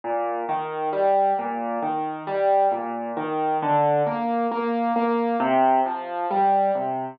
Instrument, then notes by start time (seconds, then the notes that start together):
acoustic grand piano
0.04 A#2
0.49 D#3
0.93 G3
1.39 A#2
1.82 D#3
2.27 G3
2.71 A#2
3.17 D#3
3.62 D3
4.07 A#3
4.51 A#3
4.96 A#3
5.40 C3
5.86 F3
6.31 G3
6.75 C3